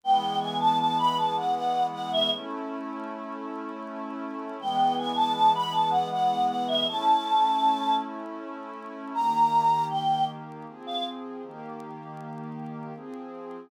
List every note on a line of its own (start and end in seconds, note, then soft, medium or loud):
0.03 2.29 E3 medium
0.03 2.29 G#3 medium
0.03 2.29 B3 medium
0.03 0.38 G5 medium
0.40 0.58 G#5 medium
0.60 0.78 A5 medium
0.79 0.97 A5 medium
0.99 1.17 B5 medium
1.17 1.35 A5 medium
1.37 1.55 F#5 medium
1.55 1.86 F#5 medium
1.92 2.10 F#5 medium
2.12 2.30 E5 medium
2.31 4.57 A3 medium
2.31 4.57 C#4 medium
2.31 4.57 E4 medium
4.59 6.85 E3 medium
4.59 6.85 G#3 medium
4.59 6.85 B3 medium
4.59 4.94 G5 medium
4.98 5.16 G#5 medium
5.16 5.33 A5 medium
5.34 5.52 A5 medium
5.55 5.73 B5 medium
5.72 5.90 A5 medium
5.91 6.09 F#5 medium
6.11 6.47 F#5 medium
6.48 6.66 F#5 medium
6.68 6.86 E5 medium
6.87 9.13 A3 medium
6.87 9.13 C#4 medium
6.87 9.13 E4 medium
6.87 7.94 A5 medium
9.14 10.65 D#3 medium
9.14 10.65 A#3 medium
9.14 10.65 G4 medium
9.14 9.85 A#5 medium
9.90 10.24 G5 medium
10.67 11.42 F3 medium
10.67 11.42 C4 medium
10.67 11.42 G#4 medium
10.86 11.04 F5 medium
11.43 12.93 D#3 medium
11.43 12.93 A#3 medium
11.43 12.93 G4 medium
12.95 13.70 F3 medium
12.95 13.70 C4 medium
12.95 13.70 G#4 medium